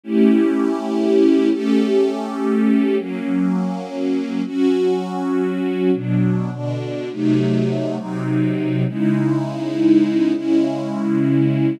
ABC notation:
X:1
M:5/4
L:1/8
Q:1/4=102
K:C#phr
V:1 name="String Ensemble 1"
[A,CE=G]5 [A,CGA]5 | [F,^A,C]5 [F,CF]5 | [B,,F,D]2 [B,,D,D]2 [^B,,F,A,^D]3 [B,,F,^B,D]3 | [C,G,^DE]5 [C,G,CE]5 |]